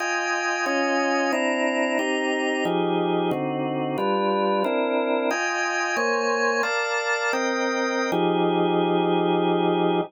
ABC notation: X:1
M:4/4
L:1/8
Q:"Swing" 1/4=181
K:Fm
V:1 name="Drawbar Organ"
[Fega]4 [DFea]4 | [C=D=Eb]4 [C_EGb]4 | [F,EGA]4 [=D,CE^F]4 | [G,=DF=B]4 [CD=E_B]4 |
[Fega]4 [B,cda]4 | "^rit." [B=df=a]4 [CBeg]4 | [F,EGA]8 |]